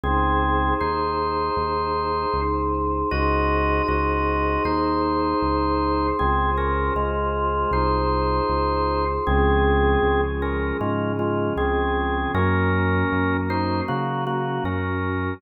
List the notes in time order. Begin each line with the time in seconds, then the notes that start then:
0.04 C#2 C4 D#4 G#4 C5
0.81 D#2 D#4 C5
1.57 D#2
2.34 C#2
3.11 C#2 D#4 F#4 G#4 C5 D#5
3.88 C#2 F#4 D#5
4.65 D#2 D#4 C5
5.42 C#2
6.19 C#2 C4 F4 G#4 C5
6.58 C#4 A#4
6.95 C#2 G#3 F4
7.71 C2 D#4 C5
8.49 C#2
9.27 C#2 F3 G#3 C4 C#4 G#4
10.03 C#2
10.42 C#4 A#4
10.79 G#2 C#3 F3 G#3 C#4 F4
11.19 G#3 F4
11.57 C#2 C4 G#4
12.33 F#2 F#3 A#3 C#4 A#4
13.13 F#2
13.50 D#4 C5
13.87 C#3 F#3 A#3 C#4 F#4
14.27 A#3 F#4
14.64 F#2 C#4 A#4